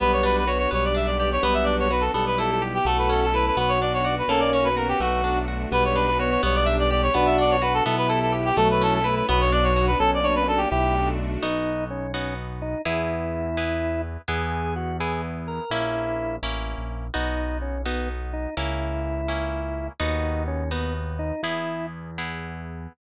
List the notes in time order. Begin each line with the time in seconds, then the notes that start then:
0.00 B1 G3 B3 D4 F#4 B4
0.13 C#5
0.23 D4 B4
0.37 B4
0.47 B3 F#4 C#5
0.59 C#5
0.71 B1 G3 B3 D4 G4 C#5
0.84 D5
0.94 D4 E5
1.06 D5
1.18 G4 D5
1.32 C#5
1.43 B1 G3 B3 D4 F#4 B4
1.54 E5
1.64 D4 D5
1.80 C#5
1.90 B3 F#4 B4
2.01 A4
2.13 B1 G3 B3 E4 G4 A4
2.27 B4
2.38 E4 A4
2.51 A4
2.62 G4
2.74 G4
2.85 B1 A3 C#4 E4 F#4 A4
2.98 B4
3.09 C#4 A4
3.24 A4
3.34 E4 A4 B4
3.47 B4
3.56 B1 B3 D4 F#4 B4
3.69 C#5
3.81 D4 D5
3.94 C#5
4.04 F#4 D5
4.19 B4
4.28 B1 A#3 C#4 F#4 A4
4.40 D5
4.53 C#4 C#5
4.64 B4
4.76 B3 F#4 A#4
4.88 G4
5.00 B1 A3 B3 D4 F#4
5.24 D4
5.48 F#4
5.71 B1 G3 B3 D4 F#4 B4
5.85 C#5
5.95 D4 B4
6.07 B4
6.19 B3 F#4 C#5
6.30 C#5
6.42 B1 G3 B3 D4 G4 C#5
6.55 D5
6.65 D4 E5
6.79 D5
6.90 G4 D5
7.03 C#5
7.14 B1 B3 D4 F#4 B4
7.26 E5
7.38 D4 D5
7.50 C#5
7.62 F#4 B4
7.74 A4
7.84 B1 B3 E4 G4 A4
7.98 B4
8.08 E4 A4
8.22 A4
8.33 G4
8.45 G4
8.57 B1 F#3 A3 C#4 E4 A4
8.71 B4
8.81 C#4 A4
8.94 A4
9.03 A3 E4 B4
9.15 B4
9.28 B1 F#3 B3 D4 F#4 B4
9.40 C#5
9.52 D4 D5
9.63 C#5
9.75 F#4 C#5
9.87 B4
9.99 B1 A#3 C#4 F#4 A4
10.14 D5
10.23 D4 C#5
10.35 B4
10.48 D4 A4
10.57 G4
10.70 B1 A3 D4 E4 F#4 G4
11.43 B1 B3 D#4 F#4
11.90 C#4
12.14 B3 C#4 D#4 F#4
12.62 D#4
12.85 E2 B3 E4 G#4
13.57 B3 E4 G#4
14.28 E2 B3 E4 G#4
14.76 F#4
15.00 B3 E4 G#4
15.48 A#4
15.70 A#1 A#3 C#4 E4
16.43 A1 A#3 C#4 E4
16.78 A#1
17.14 B1 B3 D#4 F#4
17.62 C#4
17.86 B3 D#4 F#4
18.33 D#4
18.57 C#2 A#3 C#4 E4
19.28 A#3 C#4 E4
20.00 D#2 B3 D#4 F#4
20.48 C#4
20.71 B3 D#4 F#4
21.19 D#4
21.43 E2 B3 E4 G#4
22.18 B3 E4 G#4